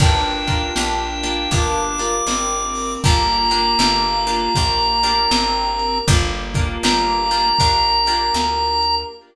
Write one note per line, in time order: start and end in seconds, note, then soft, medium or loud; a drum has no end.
0.00 0.70 G1 medium
0.00 0.44 A#3 medium
0.00 1.51 A#3 medium
0.00 0.44 D4 loud
0.00 2.00 D4 loud
0.00 1.51 D4 medium
0.00 0.44 F4 loud
0.00 1.51 F4 medium
0.00 0.44 G4 medium
0.00 1.51 G4 medium
0.00 1.52 G5 medium
0.00 kick medium
0.00 crash medium
0.47 0.74 A#3 medium
0.47 0.74 D4 medium
0.47 0.74 F4 medium
0.47 0.74 G4 medium
0.47 kick medium
0.47 closed hi-hat medium
0.76 1.47 A#1 medium
0.76 1.19 A#3 medium
0.76 1.19 D4 medium
0.76 1.19 F4 medium
0.76 1.19 G4 medium
0.76 snare medium
1.23 1.50 A#3 medium
1.23 1.50 D4 medium
1.23 1.50 F4 medium
1.23 1.50 G4 medium
1.23 closed hi-hat medium
1.51 2.21 G1 medium
1.51 3.02 A#3 medium
1.51 1.95 A#3 medium
1.51 3.02 D4 medium
1.51 1.95 D4 medium
1.51 1.95 F4 medium
1.51 3.02 G4 medium
1.51 1.95 G4 medium
1.51 3.02 A#4 medium
1.51 2.94 D6 medium
1.51 kick medium
1.51 closed hi-hat loud
1.98 2.97 A#3 medium
1.98 2.97 D4 medium
1.98 2.97 F4 medium
1.98 2.97 G4 medium
1.98 closed hi-hat medium
2.27 2.97 G#1 medium
2.27 3.03 C4 medium
2.27 snare medium
2.75 open hi-hat medium
3.04 3.75 G1 medium
3.04 4.54 A#3 medium
3.04 3.47 A#3 medium
3.04 5.13 A#3 loud
3.04 4.54 D4 medium
3.04 3.47 D4 medium
3.04 4.54 F4 medium
3.04 3.47 F4 medium
3.04 4.54 G4 medium
3.04 3.47 G4 medium
3.04 5.98 A#5 medium
3.04 kick medium
3.04 closed hi-hat medium
3.50 3.77 A#3 medium
3.50 3.77 D4 medium
3.50 3.77 F4 medium
3.50 3.77 G4 medium
3.50 closed hi-hat medium
3.79 4.49 G1 medium
3.79 4.23 A#3 medium
3.79 4.23 D4 medium
3.79 4.23 F4 medium
3.79 4.23 G4 medium
3.79 snare medium
4.27 4.53 A#3 medium
4.27 4.53 D4 medium
4.27 4.53 F4 medium
4.27 4.53 G4 medium
4.27 closed hi-hat medium
4.55 5.27 A#1 medium
4.55 4.99 A#3 medium
4.55 6.07 A#3 medium
4.55 4.99 D4 medium
4.55 6.07 D4 medium
4.55 4.99 F4 medium
4.55 4.99 G4 medium
4.55 6.07 G4 medium
4.55 6.08 A#4 medium
4.55 kick medium
4.55 closed hi-hat medium
5.03 6.01 A#3 medium
5.03 6.01 D4 medium
5.03 6.01 F4 medium
5.03 6.01 G4 medium
5.03 closed hi-hat medium
5.31 6.01 G#1 medium
5.31 5.99 C4 medium
5.31 snare loud
5.79 closed hi-hat medium
6.08 6.78 G1 loud
6.08 6.51 A#3 medium
6.08 7.49 A#3 loud
6.08 7.58 A#3 medium
6.08 6.51 D4 loud
6.08 7.58 D4 medium
6.08 6.51 F4 medium
6.08 7.58 F4 medium
6.08 6.51 G4 medium
6.08 7.58 G4 medium
6.08 kick medium
6.08 closed hi-hat medium
6.54 6.81 A#3 medium
6.54 6.81 D4 medium
6.54 6.81 F4 medium
6.54 6.81 G4 medium
6.54 kick medium
6.54 closed hi-hat medium
6.83 7.53 G1 medium
6.83 7.27 A#3 medium
6.83 7.27 D4 medium
6.83 7.27 F4 medium
6.83 7.27 G4 medium
6.83 8.95 A#5 medium
6.83 snare loud
7.31 7.57 A#3 medium
7.31 7.57 D4 medium
7.31 7.57 F4 medium
7.31 7.57 G4 medium
7.31 closed hi-hat medium
7.58 8.31 A#1 medium
7.58 9.09 A#3 medium
7.58 8.03 A#3 medium
7.58 9.09 D4 medium
7.58 8.03 D4 medium
7.58 8.03 F4 medium
7.58 9.09 G4 medium
7.58 8.03 G4 medium
7.58 9.09 A#4 medium
7.58 kick medium
7.58 closed hi-hat medium
8.06 9.05 A#3 medium
8.06 9.05 D4 medium
8.06 9.05 F4 medium
8.06 9.05 G4 medium
8.06 closed hi-hat medium
8.34 9.05 D2 medium
8.34 snare medium
8.83 closed hi-hat medium